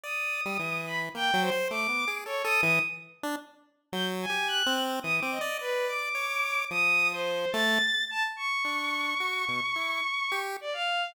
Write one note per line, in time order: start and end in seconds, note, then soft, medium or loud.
0.03 0.41 D5 medium
0.03 0.79 D#6 medium
0.45 0.58 G3 medium
0.59 1.09 E3 medium
0.87 0.99 B5 medium
1.15 1.31 A#3 medium
1.15 1.40 G5 medium
1.34 1.50 F#3 loud
1.41 1.66 C5 medium
1.52 1.68 C5 medium
1.70 1.88 A3 medium
1.70 2.08 D6 loud
1.89 2.05 B3 medium
2.08 2.24 G#4 medium
2.26 2.42 A4 medium
2.26 2.42 C#5 medium
2.44 2.61 A4 loud
2.44 2.61 D#6 loud
2.62 2.79 E3 loud
2.62 2.79 D#6 loud
3.23 3.36 D4 loud
3.92 4.26 F#3 loud
3.92 4.05 G6 medium
4.22 4.47 G#5 medium
4.30 4.63 G4 medium
4.48 4.73 F#6 loud
4.66 5.00 C4 loud
5.03 5.20 E3 medium
5.03 5.15 D#6 loud
5.19 5.39 C4 medium
5.19 5.31 D6 medium
5.31 5.56 D#5 medium
5.41 5.58 D5 loud
5.59 5.86 B4 medium
5.59 6.09 D5 medium
5.87 6.62 D6 medium
6.15 6.65 C#5 medium
6.71 7.46 F3 medium
6.71 7.08 D#6 loud
7.12 7.50 C5 medium
7.52 7.79 A3 loud
7.52 8.02 A6 medium
8.10 8.23 A5 medium
8.36 10.36 C#6 medium
8.65 9.15 D4 medium
9.20 9.45 F#4 medium
9.48 9.61 B2 medium
9.76 10.01 E4 medium
10.32 10.57 G4 medium
10.61 10.73 D5 medium
10.73 11.11 F5 medium